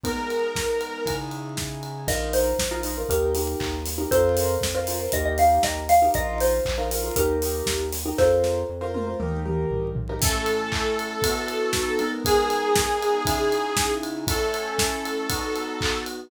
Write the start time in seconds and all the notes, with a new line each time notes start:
0.03 G#3 B3 D#4 A#4, kick, ride
0.30 ride
0.56 kick, snare
0.81 ride
1.06 C#3 D#4 E4 G#4, kick, ride
1.31 ride
1.57 kick, snare
1.83 ride
2.08 A#1 D#4 F4 A#4 D#5, kick, crash
2.33 C5, open hi-hat
2.59 A#1, kick, snare
2.71 D#4 F4 A#4
2.83 D#4 F4 A#4, open hi-hat
2.97 D#4 F4 A#4
3.09 D#2 D#4 G4 A#4, kick, closed hi-hat
3.35 D#4 G4 A#4, open hi-hat
3.60 D#2, kick, clap
3.85 snare, open hi-hat
3.98 D#4 G4 A#4
4.11 F2 F4 A4 A#4 C5, kick, closed hi-hat
4.37 open hi-hat
4.61 F2, kick, snare
4.75 F4 A#4 C5
4.87 F4 A#4 C5, open hi-hat
5.01 F4 A#4 C5
5.12 D#2 D#4 G4 A#4 D#5, kick, closed hi-hat
5.26 D#5
5.38 D#4 G4 A#4 F5, open hi-hat
5.63 D#2 D#5, kick, snare
5.89 F5, snare, open hi-hat
6.02 D#4 G4 A#4
6.14 A#1 D#4 F4 A#4 D#5, kick, closed hi-hat
6.40 C5, open hi-hat
6.65 A#1, kick, clap
6.78 D#4 F4 A#4
6.91 D#4 F4 A#4, open hi-hat
7.04 D#4 F4 A#4
7.16 D#2 D#4 G4 A#4, kick, closed hi-hat
7.42 D#4 G4 A#4, open hi-hat
7.66 D#2, kick, snare
7.92 snare, open hi-hat
8.05 D#4 G4 A#4
8.18 F2 F4 A4 A#4 C5, kick, snare
8.44 snare
8.69 F2
8.81 F4 A#4 C5
8.94 F4 A#4 C5, high tom
9.07 F4 A#4 C5
9.20 D#2 D#4 G4 A#4, mid tom
9.45 D#4 G4 A#4, mid tom
9.71 C2, floor tom
9.95 B1, floor tom
10.09 D#4 G4 A#4
10.21 A3 C#4 E4 A4, kick, crash
10.46 ride
10.72 kick, clap
10.99 ride
11.22 B3 E4 F#4, kick, ride
11.48 ride
11.73 B3 D#4 F#4, kick, snare
11.99 G#3 B3 D#4 A#4, ride
12.24 G#4, kick, ride
12.50 ride
12.75 kick, snare
13.02 ride
13.25 C#3 D#4 E4 G#4, kick, ride
13.52 ride
13.77 kick, snare
14.03 ride
14.27 A3 C#4 E4 A4, kick, ride
14.54 ride
14.78 kick, snare
15.05 ride
15.30 B3 D#4 F#4, kick, ride
15.56 ride
15.81 kick, clap
16.06 ride